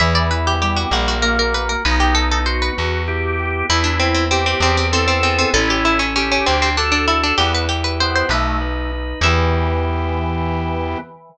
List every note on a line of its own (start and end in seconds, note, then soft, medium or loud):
0.00 0.85 E2 loud
0.00 0.54 E3 loud
0.00 0.87 B3 medium
0.00 0.14 E5 loud
0.15 0.30 D5 medium
0.31 0.89 E4 medium
0.31 0.45 B4 medium
0.47 0.61 G4 medium
0.62 1.15 G3 medium
0.62 0.91 G4 medium
0.62 0.76 G4 medium
0.77 0.91 F#4 medium
0.91 1.76 A#1 loud
0.91 1.53 A#3 loud
0.91 1.07 F#4 medium
1.08 1.23 F#4 medium
1.22 1.72 A#3 loud
1.22 1.82 F#4 medium
1.22 1.37 A#4 medium
1.39 1.54 A#4 medium
1.54 1.83 A#3 medium
1.54 1.69 B4 medium
1.69 1.84 A#4 medium
1.85 2.70 B1 loud
1.85 2.72 B3 loud
1.85 2.40 D#4 loud
1.85 2.00 B4 medium
2.00 2.15 G4 medium
2.14 2.73 D#4 medium
2.14 2.29 A4 medium
2.31 2.46 A4 loud
2.46 3.03 F#4 loud
2.46 2.76 F#4 medium
2.46 2.61 C5 medium
2.62 3.50 B4 medium
2.77 3.63 E2 medium
2.77 3.64 B3 medium
3.07 3.66 E4 medium
3.07 3.66 G4 loud
3.39 3.68 G4 medium
3.69 4.54 E2 loud
3.69 4.57 B3 medium
3.69 4.25 E4 loud
3.69 3.84 E4 loud
3.84 3.98 D4 loud
3.99 4.14 C4 medium
3.99 4.58 E4 medium
4.14 4.29 C4 medium
4.31 4.46 C4 medium
4.31 4.60 G4 medium
4.31 4.86 G4 loud
4.46 4.61 C4 medium
4.60 5.45 E2 loud
4.60 5.50 B3 loud
4.60 4.77 C4 medium
4.77 4.92 C4 medium
4.92 5.07 C4 loud
4.92 5.51 E4 medium
4.92 5.50 A4 loud
5.08 5.22 C4 medium
5.23 5.38 C4 medium
5.23 5.52 G#4 medium
5.38 5.53 C4 medium
5.54 6.38 A1 loud
5.54 6.15 C#4 loud
5.54 6.05 E4 loud
5.54 5.68 A4 loud
5.70 5.85 G4 medium
5.84 6.00 E4 medium
5.84 6.43 A4 medium
5.99 6.14 C#4 medium
6.16 6.30 C#4 loud
6.16 6.45 C#4 medium
6.16 6.69 G4 loud
6.32 6.46 C#4 medium
6.46 7.33 D2 medium
6.46 6.61 C4 medium
6.46 7.33 D4 medium
6.62 6.77 C4 medium
6.77 6.91 D4 loud
6.77 7.36 F#4 medium
6.77 7.35 A4 loud
6.92 7.06 D4 medium
7.08 7.22 E4 medium
7.08 7.37 A4 medium
7.23 7.38 D4 medium
7.38 8.23 E2 loud
7.38 7.65 B3 loud
7.38 8.26 E4 loud
7.38 7.52 G4 loud
7.54 7.69 B4 medium
7.69 7.83 G4 medium
7.69 8.28 G4 medium
7.84 7.99 B4 medium
8.00 8.28 B3 medium
8.00 8.29 B4 medium
8.00 8.15 C5 loud
8.16 8.30 C5 medium
8.29 9.14 B1 loud
8.29 8.58 A3 loud
8.29 8.91 D#4 medium
8.29 8.91 B4 medium
8.61 9.20 B4 medium
8.92 9.21 D#4 medium
9.21 10.95 E2 loud
9.21 10.98 E3 loud
9.21 10.98 B3 loud
9.21 10.98 E4 loud
9.21 10.98 G4 loud
9.21 10.98 E5 loud